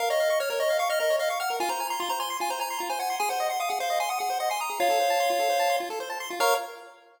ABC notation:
X:1
M:4/4
L:1/16
Q:1/4=150
K:Bbm
V:1 name="Lead 1 (square)"
f e2 e d d e2 f e e2 e f g2 | a b2 b c' b c'2 a b b2 b a g2 | a g2 g f g f2 a g g2 g a b2 | [df]10 z6 |
b4 z12 |]
V:2 name="Lead 1 (square)"
B d f d' f' B d f d' f' B d f d' f' B | F c a c' F c a c' F c a c' F c a c' | A c e c' e' A c e c' e' A c e c' e' A | F =A c =a c' F A c a c' F A c a c' F |
[Bdf]4 z12 |]